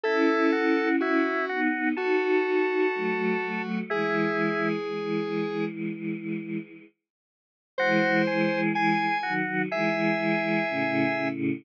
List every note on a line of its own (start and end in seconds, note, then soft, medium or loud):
0.04 1.29 C#4 medium
0.04 1.29 E4 medium
0.04 0.51 E4 medium
0.04 0.89 A4 loud
0.52 0.96 F#4 medium
1.00 1.45 E4 loud
1.00 1.60 F#4 medium
1.49 1.95 B3 medium
1.49 1.95 D#4 medium
1.49 1.89 F#4 loud
1.97 2.88 D#4 medium
1.97 3.79 F#4 medium
1.97 2.88 F#4 medium
1.97 3.62 A4 medium
2.95 3.37 F#3 medium
2.95 3.37 A3 medium
3.43 3.83 F#3 medium
3.43 3.83 A3 medium
3.90 4.78 E3 medium
3.90 4.78 G#3 medium
3.90 4.69 E4 medium
3.90 5.65 G#4 loud
4.88 6.58 E3 medium
4.88 6.58 G#3 medium
7.78 9.06 E3 medium
7.78 9.06 G#3 medium
7.78 8.22 F#4 loud
7.78 8.61 C5 loud
8.27 8.72 G#4 medium
8.75 9.18 G#4 medium
8.75 9.33 G#5 loud
9.23 9.69 D#3 medium
9.23 9.69 F#3 medium
9.23 9.62 F#4 loud
9.71 10.64 E3 medium
9.71 10.64 G#3 medium
9.71 11.28 G#4 medium
9.71 11.28 E5 loud
10.69 11.14 A2 medium
10.69 11.14 C#3 medium
11.17 11.61 A2 medium
11.17 11.61 C#3 medium